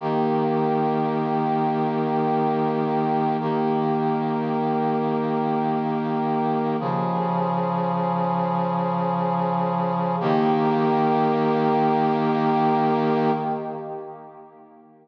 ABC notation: X:1
M:3/4
L:1/8
Q:1/4=53
K:Ebmix
V:1 name="Brass Section"
[E,B,G]6 | [E,B,G]6 | [D,F,A]6 | [E,B,G]6 |]